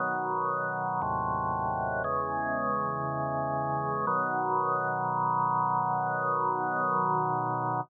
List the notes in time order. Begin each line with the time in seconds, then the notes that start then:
0.00 B2 D#3 F#3
1.02 D#2 A2 C3 F#3
2.04 E2 C#3 G#3
4.07 B2 D#3 F#3